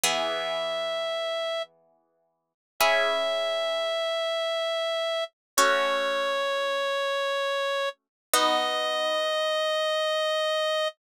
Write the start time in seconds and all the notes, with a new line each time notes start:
0.04 E3 B3 G#4 E5
2.80 C#4 E4 G#4 E5
5.57 A3 C#4 F#4 C#5
8.34 B3 D#4 F#4 D#5